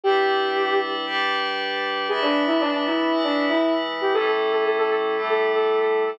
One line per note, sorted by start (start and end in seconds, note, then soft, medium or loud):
0.04 1.05 G3 medium
0.04 1.05 D4 medium
0.04 1.05 E4 loud
0.04 0.77 G4 loud
0.04 1.05 B4 medium
1.06 2.07 G3 medium
1.06 2.07 D4 medium
1.06 2.07 G4 medium
1.06 2.07 B4 loud
2.08 3.10 E3 loud
2.08 3.10 G#3 medium
2.08 3.10 D4 medium
2.08 2.21 G#4 loud
2.08 3.10 B4 loud
2.21 2.43 D4 loud
2.47 2.59 E4 loud
2.60 2.72 D4 loud
2.72 2.85 D4 loud
2.86 3.18 E4 medium
3.11 4.13 E3 medium
3.11 4.13 G#3 medium
3.11 4.13 E4 medium
3.11 4.13 B4 medium
3.24 3.45 D4 loud
3.49 3.73 E4 medium
4.01 4.13 G4 medium
4.13 5.15 A2 medium
4.13 5.15 G3 loud
4.13 5.15 C#4 medium
4.13 5.15 E4 medium
4.13 4.26 A4 loud
4.27 4.51 A4 loud
4.52 4.64 A4 medium
4.65 4.77 A4 medium
4.78 4.90 A4 loud
4.90 5.21 A4 loud
5.16 6.18 A2 loud
5.16 6.18 G3 medium
5.16 6.18 A3 medium
5.16 6.18 E4 medium
5.29 5.51 A4 loud
5.55 5.79 A4 loud
5.80 6.04 A4 medium
6.06 6.18 A4 loud